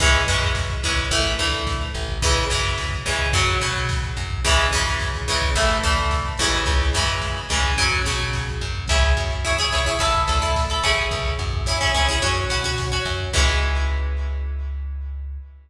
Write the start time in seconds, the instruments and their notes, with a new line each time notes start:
0.00 electric bass (finger) C#2, acoustic guitar (steel) E3 G#3 C#4, kick, crash
0.14 kick
0.27 electric bass (finger) F#2, acoustic guitar (steel) E3 G#3 C#4, kick, closed hi-hat
0.43 kick
0.55 kick, snare
0.70 kick
0.83 electric bass (finger) C#2, acoustic guitar (steel) E3 G#3 C#4, kick, closed hi-hat
0.97 kick
1.11 electric bass (finger) A1, acoustic guitar (steel) E3 A3, kick, closed hi-hat
1.24 kick
1.39 electric bass (finger) D2, acoustic guitar (steel) E3 A3, kick, closed hi-hat
1.52 kick
1.67 kick, snare
1.81 kick
1.94 electric bass (finger) A1, kick, closed hi-hat
2.08 kick
2.22 electric bass (finger) C#2, acoustic guitar (steel) C#3 E3 G#3, kick, closed hi-hat
2.35 kick
2.50 electric bass (finger) F#2, acoustic guitar (steel) C#3 E3 G#3, kick, closed hi-hat
2.64 kick
2.78 kick, snare
2.91 kick
3.06 electric bass (finger) C#2, acoustic guitar (steel) C#3 E3 G#3, kick, closed hi-hat
3.19 kick
3.33 electric bass (finger) F#2, acoustic guitar (steel) C#3 F#3, kick, closed hi-hat
3.47 kick
3.61 electric bass (finger) B2, acoustic guitar (steel) C#3 F#3, kick, closed hi-hat
3.74 kick
3.89 kick, snare
4.03 kick
4.17 electric bass (finger) F#2, kick, closed hi-hat
4.30 kick
4.44 electric bass (finger) C#2, acoustic guitar (steel) C#3 E3 G#3, kick, closed hi-hat
4.57 kick
4.71 electric bass (finger) F#2, acoustic guitar (steel) C#3 E3 G#3, kick, closed hi-hat
4.87 kick
4.99 kick, snare
5.14 kick
5.28 electric bass (finger) C#2, acoustic guitar (steel) C#3 E3 G#3, kick, closed hi-hat
5.41 kick
5.55 electric bass (finger) A1, acoustic guitar (steel) E3 A3, kick, closed hi-hat
5.69 kick
5.83 electric bass (finger) D2, acoustic guitar (steel) E3 A3, kick, closed hi-hat
5.98 kick
6.10 kick, snare
6.25 kick
6.38 electric bass (finger) A1, acoustic guitar (steel) C#3 E3 G#3, kick, closed hi-hat
6.53 kick
6.66 electric bass (finger) C#2, kick, closed hi-hat
6.81 kick
6.93 electric bass (finger) F#2, acoustic guitar (steel) C#3 E3 G#3, kick, closed hi-hat
7.08 kick
7.21 kick, snare
7.49 electric bass (finger) C#2, acoustic guitar (steel) C#3 E3 G#3, kick, closed hi-hat
7.64 kick
7.77 electric bass (finger) F#2, acoustic guitar (steel) C#3 F#3, kick, closed hi-hat
7.91 kick
8.05 electric bass (finger) B2, acoustic guitar (steel) C#3 F#3, kick, closed hi-hat
8.20 kick
8.33 kick, snare
8.47 kick
8.61 electric bass (finger) F#2, kick, closed hi-hat
8.75 kick
8.88 electric bass (finger) C#2, acoustic guitar (steel) E4 G#4 C#5, kick, closed hi-hat
9.03 kick
9.17 electric bass (finger) F#2, kick, closed hi-hat
9.30 kick
9.44 acoustic guitar (steel) E4 G#4 C#5, kick, snare
9.58 acoustic guitar (steel) E4 G#4 C#5, kick
9.72 electric bass (finger) C#2, acoustic guitar (steel) E4 G#4 C#5, kick, closed hi-hat
9.85 acoustic guitar (steel) E4 G#4 C#5, kick
9.99 electric bass (finger) A1, acoustic guitar (steel) E4 A4, kick, closed hi-hat
10.14 kick
10.27 electric bass (finger) D2, acoustic guitar (steel) E4 A4, kick, closed hi-hat
10.42 acoustic guitar (steel) E4 A4, kick
10.55 kick, snare
10.69 acoustic guitar (steel) E4 A4, kick
10.83 electric bass (finger) A1, acoustic guitar (steel) C#4 E4 G#4, kick, closed hi-hat
10.97 kick
11.11 electric bass (finger) C#2, kick, closed hi-hat
11.25 kick
11.38 electric bass (finger) F#2, kick, closed hi-hat
11.53 kick
11.66 acoustic guitar (steel) C#4 E4 G#4, kick, snare
11.81 acoustic guitar (steel) C#4 E4 G#4, kick
11.94 electric bass (finger) C#2, acoustic guitar (steel) C#4 E4 G#4, kick, closed hi-hat
12.08 acoustic guitar (steel) C#4 E4 G#4, kick
12.22 electric bass (finger) F#2, acoustic guitar (steel) C#4 F#4, kick, closed hi-hat
12.36 kick
12.50 electric bass (finger) B2, acoustic guitar (steel) C#4 F#4, kick, closed hi-hat
12.64 acoustic guitar (steel) C#4 F#4, kick
12.78 kick, snare
12.92 acoustic guitar (steel) C#4 F#4, kick
13.05 electric bass (finger) F#2, kick, closed hi-hat
13.20 kick
13.33 electric bass (finger) C#2, acoustic guitar (steel) E3 G#3 C#4, kick, crash